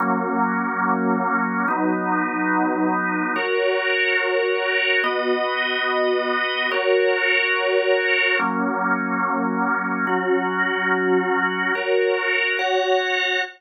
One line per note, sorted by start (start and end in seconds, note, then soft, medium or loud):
0.00 1.66 F#3 medium
0.00 1.66 A#3 medium
0.00 1.66 C#4 medium
1.68 3.34 F#3 medium
1.68 3.34 B3 medium
1.68 3.34 D#4 medium
3.36 5.02 F#4 medium
3.36 5.02 A#4 medium
3.36 5.02 C#5 medium
5.04 6.70 B3 medium
5.04 6.70 F#4 medium
5.04 6.70 D#5 medium
6.71 8.37 F#4 medium
6.71 8.37 A#4 medium
6.71 8.37 C#5 medium
8.39 10.05 F#3 medium
8.39 10.05 A#3 medium
8.39 10.05 C#4 medium
10.07 11.73 F#3 medium
10.07 11.73 C#4 medium
10.07 11.73 F#4 medium
11.75 12.58 F#4 medium
11.75 12.58 A#4 medium
11.75 12.58 C#5 medium
12.59 13.42 F#4 medium
12.59 13.42 C#5 medium
12.59 13.42 F#5 medium